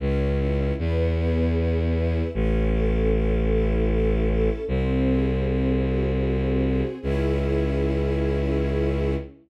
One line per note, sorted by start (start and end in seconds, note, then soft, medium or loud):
0.00 0.72 C#2 loud
0.00 0.74 C#4 loud
0.39 0.76 E4 medium
0.78 2.22 E2 loud
0.78 1.55 B3 loud
1.17 2.28 G#4 medium
1.56 2.30 B3 medium
1.95 2.32 E4 medium
2.34 4.49 A1 loud
2.34 3.11 C#4 loud
2.73 4.28 A4 medium
3.12 3.89 C#4 medium
3.50 4.62 E4 medium
3.89 4.63 C#4 medium
4.29 4.66 A4 medium
4.67 6.83 C2 loud
4.67 5.45 C4 medium
5.07 6.62 G#4 medium
5.45 6.23 C4 medium
5.85 6.96 F#4 medium
6.23 6.97 C4 medium
6.63 7.00 G#4 medium
7.02 9.16 C#2 loud
7.02 9.14 C#4 loud
7.02 9.14 E4 loud
7.02 9.14 G#4 loud